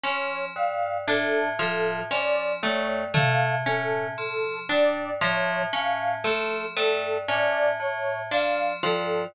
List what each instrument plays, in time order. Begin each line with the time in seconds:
0.03 tubular bells F3, orchestral harp C#4, ocarina C#5
0.56 tubular bells G2, ocarina F5
1.07 tubular bells A2, orchestral harp D4, ocarina A4
1.59 tubular bells A2, orchestral harp F3, ocarina A4
2.11 tubular bells F3, orchestral harp C#4, ocarina D5, cowbell
2.63 tubular bells G2, orchestral harp A3, ocarina C#5
3.14 tubular bells A2, orchestral harp A3, ocarina F5, floor tom
3.66 tubular bells A2, orchestral harp C#4, ocarina A4
4.18 tubular bells F3, ocarina A4
4.69 tubular bells G2, orchestral harp D4, ocarina D5
5.21 tubular bells A2, orchestral harp F3, ocarina C#5
5.73 tubular bells A2, orchestral harp C#4, ocarina F5
6.24 tubular bells F3, orchestral harp A3, ocarina A4
6.77 tubular bells G2, orchestral harp A3, ocarina A4, cowbell
7.28 tubular bells A2, orchestral harp C#4, ocarina D5
7.80 tubular bells A2, ocarina C#5
8.31 tubular bells F3, orchestral harp D4, ocarina F5
8.83 tubular bells G2, orchestral harp F3, ocarina A4